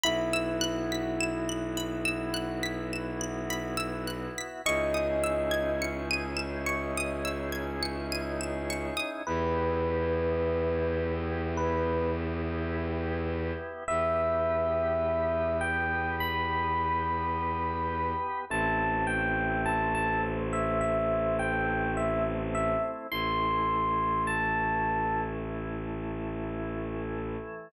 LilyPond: <<
  \new Staff \with { instrumentName = "Electric Piano 1" } { \time 4/4 \key e \major \tempo 4 = 52 e'1 | dis''4 r2. | \key e \minor b'2 b'8 r4. | e''4. g''8 b''2 |
a''8 g''8 a''16 a''16 r16 e''16 e''8 g''8 e''16 r16 e''16 r16 | c'''4 a''4 r2 | }
  \new Staff \with { instrumentName = "Pizzicato Strings" } { \time 4/4 \key e \major b''16 e'''16 fis'''16 b'''16 e''''16 fis''''16 b''16 e'''16 fis'''16 b'''16 e''''16 fis''''16 b''16 e'''16 fis'''16 b'''16 | cis'''16 dis'''16 e'''16 gis'''16 cis''''16 dis''''16 e''''16 cis'''16 dis'''16 e'''16 gis'''16 cis''''16 dis''''16 e''''16 cis'''16 dis'''16 | \key e \minor r1 | r1 |
r1 | r1 | }
  \new Staff \with { instrumentName = "Drawbar Organ" } { \time 4/4 \key e \major <b e' fis'>1 | <cis' dis' e' gis'>1 | \key e \minor <b e' g'>1 | <b g' b'>1 |
<a c' e'>1 | <e a e'>1 | }
  \new Staff \with { instrumentName = "Violin" } { \clef bass \time 4/4 \key e \major b,,1 | cis,1 | \key e \minor e,1 | e,1 |
a,,1 | a,,1 | }
>>